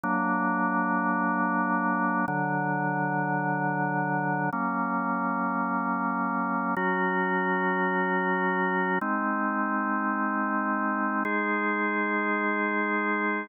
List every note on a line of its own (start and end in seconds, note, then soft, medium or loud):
0.04 2.26 F#3 loud
0.04 2.26 A#3 loud
0.04 2.26 D4 loud
2.28 4.50 D3 medium
2.28 4.50 F#3 medium
2.28 4.50 D4 medium
4.53 6.75 F#3 medium
4.53 6.75 A#3 medium
4.53 6.75 C#4 medium
6.77 8.99 F#3 loud
6.77 8.99 C#4 medium
6.77 8.99 F#4 loud
9.01 11.23 G#3 loud
9.01 11.23 C4 medium
9.01 11.23 D#4 medium
11.25 13.47 G#3 loud
11.25 13.47 D#4 medium
11.25 13.47 G#4 medium